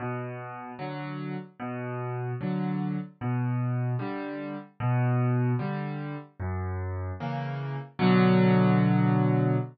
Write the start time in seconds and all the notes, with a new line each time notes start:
0.00 B2
0.79 D3 F#3
1.60 B2
2.41 D3 F#3
3.21 B2
3.99 D3 G3
4.80 B2
5.59 D3 G3
6.40 F#2
7.20 C#3 E3 A#3
7.99 B2 D3 F#3